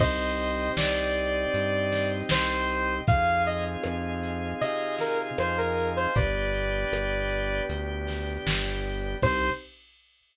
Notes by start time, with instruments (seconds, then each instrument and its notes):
0.00 synth bass 1 C2, drawbar organ C4 D#4 G4, pad 2 (warm) C5 D#5 G5, lead 2 (sawtooth) C5 D#5, kick, crash
0.39 closed hi-hat
0.77 synth bass 1 C2, lead 2 (sawtooth) D5, snare
1.16 closed hi-hat
1.54 synth bass 1 G2, closed hi-hat
1.92 snare, closed hi-hat
2.29 synth bass 1 C2, lead 2 (sawtooth) C5, snare
2.68 closed hi-hat
3.07 synth bass 1 F2, drawbar organ C4 D#4 F4 G#4, pad 2 (warm) C5 D#5 F5 G#5, lead 2 (sawtooth) F5, kick, closed hi-hat
3.46 lead 2 (sawtooth) D#5, closed hi-hat
3.84 synth bass 1 F2, cross-stick
4.23 closed hi-hat
4.61 synth bass 1 C3, lead 2 (sawtooth) D#5, closed hi-hat
4.99 lead 2 (sawtooth) A#4, snare, closed hi-hat
5.38 synth bass 1 F2, lead 2 (sawtooth) C5, cross-stick
5.58 lead 2 (sawtooth) A#4
5.78 closed hi-hat
5.96 lead 2 (sawtooth) C5
6.14 synth bass 1 G1, drawbar organ B3 D4 G4, pad 2 (warm) B4 D5 G5, lead 2 (sawtooth) B4 D5, kick, closed hi-hat
6.54 closed hi-hat
6.92 synth bass 1 G1, cross-stick
7.30 closed hi-hat
7.69 synth bass 1 D2, closed hi-hat
8.07 snare, closed hi-hat
8.46 synth bass 1 G1, snare
8.85 open hi-hat
9.22 synth bass 1 C2, pad 2 (warm) C4 D#4 G4, drawbar organ C4 D#4 G4, lead 2 (sawtooth) C5, kick, crash